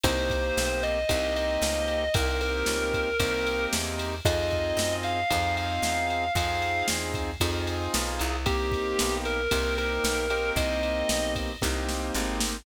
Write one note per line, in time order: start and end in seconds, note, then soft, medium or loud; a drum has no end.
0.04 0.52 C2 medium
0.04 0.99 A#3 loud
0.04 0.99 C4 loud
0.04 0.99 D#4 loud
0.04 0.99 G4 loud
0.04 0.82 C5 medium
0.04 kick medium
0.04 ride medium
0.30 kick medium
0.30 ride medium
0.57 1.05 B1 medium
0.57 snare loud
0.83 1.33 D#5 loud
0.83 ride medium
1.09 1.58 C2 loud
1.09 2.04 A#3 loud
1.09 2.04 C4 loud
1.09 2.04 D#4 loud
1.09 2.04 G4 loud
1.09 kick medium
1.09 ride medium
1.36 2.11 D#5 medium
1.36 ride medium
1.62 2.09 C#2 medium
1.62 snare loud
1.88 ride medium
2.14 2.64 C2 loud
2.14 3.10 A#3 loud
2.14 3.10 C4 loud
2.14 3.10 D#4 loud
2.14 3.10 G4 loud
2.14 2.38 A#4 medium
2.14 kick loud
2.14 ride loud
2.41 3.63 A#4 medium
2.41 ride medium
2.66 3.14 C#2 medium
2.66 snare loud
2.94 kick medium
2.94 ride medium
3.20 3.67 C2 medium
3.20 4.15 A#3 loud
3.20 4.15 C4 loud
3.20 4.15 D#4 loud
3.20 4.15 G4 loud
3.20 kick medium
3.20 ride loud
3.46 ride medium
3.73 4.21 E2 medium
3.73 snare loud
3.99 ride medium
4.25 4.73 F2 medium
4.25 5.20 C4 medium
4.25 5.20 D#4 medium
4.25 5.20 F4 medium
4.25 5.20 G#4 medium
4.25 4.92 D#5 medium
4.25 kick medium
4.25 ride medium
4.50 kick medium
4.50 ride medium
4.77 5.24 F#2 medium
4.77 snare loud
5.03 5.53 F5 medium
5.03 ride medium
5.30 5.79 F2 loud
5.30 6.25 C4 loud
5.30 6.25 D#4 loud
5.30 6.25 F4 medium
5.30 6.25 G#4 medium
5.30 kick medium
5.30 ride medium
5.57 6.31 F5 medium
5.57 ride medium
5.82 6.30 E2 medium
5.82 snare medium
6.10 ride medium
6.35 6.83 F2 medium
6.35 7.31 C4 loud
6.35 7.31 D#4 medium
6.35 7.31 F4 medium
6.35 7.31 G#4 medium
6.35 6.82 F5 loud
6.35 kick medium
6.35 ride medium
6.62 ride medium
6.88 7.37 E2 medium
6.88 snare loud
7.14 kick medium
7.14 ride medium
7.40 7.88 F2 loud
7.40 8.36 C4 medium
7.40 8.36 D#4 medium
7.40 8.36 F4 loud
7.40 8.36 G#4 medium
7.40 kick medium
7.40 ride medium
7.67 ride medium
7.94 8.20 B1 medium
7.94 snare loud
8.19 8.95 C2 medium
8.19 ride medium
8.46 9.41 A#3 loud
8.46 9.41 C4 medium
8.46 9.41 D#4 medium
8.46 9.14 G4 medium
8.46 9.41 G4 medium
8.46 kick medium
8.46 ride medium
8.72 kick medium
8.72 ride medium
8.99 9.48 B1 medium
8.99 snare loud
9.25 9.75 A#4 medium
9.25 ride medium
9.51 9.99 C2 medium
9.51 10.26 A#3 medium
9.51 10.26 C4 medium
9.51 10.26 D#4 medium
9.51 10.26 G4 loud
9.51 kick medium
9.51 ride loud
9.78 10.49 A#4 medium
9.78 ride medium
10.04 10.52 B1 medium
10.04 snare loud
10.30 11.51 A#3 medium
10.30 11.51 C4 medium
10.30 11.51 D#4 medium
10.30 11.51 G4 medium
10.30 ride medium
10.56 11.04 C2 medium
10.56 11.31 D#5 medium
10.56 kick medium
10.56 ride medium
10.83 ride medium
11.09 11.57 B1 medium
11.09 snare loud
11.36 kick medium
11.36 ride medium
11.62 12.11 C2 medium
11.62 12.57 A#3 loud
11.62 12.57 C4 loud
11.62 12.57 D#4 medium
11.62 12.57 G4 medium
11.62 kick medium
11.62 snare medium
11.89 snare medium
12.15 12.62 G#1 medium
12.15 snare medium
12.40 snare loud